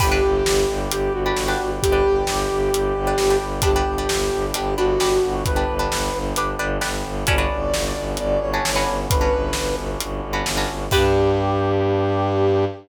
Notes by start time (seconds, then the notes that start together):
0.00 G1 D4 G4 B4 D5 G5, kick, crash
0.11 D4 G4 B4
0.23 G1
0.45 G1, snare
0.68 G1
0.90 G1 G4, closed hi-hat
1.12 G1 F#4
1.26 D4 G4 B4
1.35 G1, snare
1.48 D4 G4 B4
1.60 G1
1.82 G1 G4, kick, closed hi-hat
1.92 D4 G4 B4
2.05 G1
2.27 G1, snare
2.50 G1
2.73 G1, closed hi-hat
2.94 G1
3.07 D4 G4 B4
3.18 G1, snare
3.30 D4 G4 B4
3.41 G1
3.62 G1 B3 D4 G4 B4, kick, closed hi-hat
3.76 D4 G4 B4
3.86 G1
3.98 D4 G4 B4
4.09 G1, snare
4.31 G1
4.54 G1 D4 G4 B4, closed hi-hat
4.77 G1 D4 F#4 G4 B4
4.99 G1 D4 G4 B4, snare
5.23 G1
5.45 G1 B4, kick, closed hi-hat
5.56 D4 G4 B4
5.68 G1
5.79 D4 G4 B4
5.90 G1, snare
6.13 G1
6.35 G1 D4 G4 B4, closed hi-hat
6.59 G1 D4 G4 B4
6.81 G1 D4 G4 B4, snare
7.04 G1
7.26 G1 B3 C#4 D4 F#4 B4 D5, kick, closed hi-hat
7.38 C#4 D4 F#4 B4
7.52 G1
7.73 G1, snare
7.96 G1
8.17 G1 D5, closed hi-hat
8.40 G1 C#5
8.54 C#4 D4 F#4 B4
8.65 G1, snare
8.76 C#4 D4 F#4 B4
8.86 G1
9.09 G1 B4, kick, closed hi-hat
9.21 C#4 D4 F#4 B4
9.33 G1
9.53 G1, snare
9.76 G1
10.00 G1, closed hi-hat
10.23 G1
10.33 C#4 D4 F#4 B4
10.46 G1, snare
10.57 C#4 D4 F#4 B4
10.68 G1
10.91 G2 B3 D4 G4 B4, kick, crash